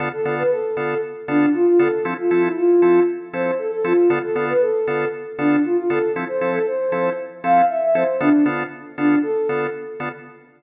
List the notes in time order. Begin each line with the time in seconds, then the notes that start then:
0.00 D3 B3 F4 A4
0.13 A4
0.25 D3 B3 F4 A4
0.38 B4
0.51 A4
0.77 D3 B3 F4 A4
1.28 D3 B3 D4 F4 A4
1.54 F4
1.67 F4
1.79 D3 B3 F4 A4
2.05 F3 C4 E4 A4
2.18 F4
2.31 F3 C4 E4 A4
2.44 E4
2.56 F4
2.82 F3 C4 E4 A4
3.33 F3 C4 E4 A4 C5
3.59 A4
3.72 A4
3.84 F3 C4 E4 F4 A4
4.10 D3 B3 F4 A4
4.23 A4
4.35 D3 B3 F4 A4
4.49 B4
4.61 A4
4.87 D3 B3 F4 A4
5.38 D3 B3 D4 F4 A4
5.64 F4
5.77 F4
5.90 D3 B3 F4 A4
6.16 F3 C4 E4 A4
6.28 C5
6.41 F3 C4 E4 A4
6.54 A4
6.67 C5
6.92 F3 C4 E4 A4
7.43 F3 C4 E4 A4 F5
7.69 E5
7.82 E5
7.95 F3 C4 E4 A4 C5
8.21 D3 B3 D4 F4 A4
8.46 D3 B3 F4 A4
8.98 D3 B3 D4 F4 A4
9.23 A4
9.49 D3 B3 F4 A4
10.00 D3 B3 F4 A4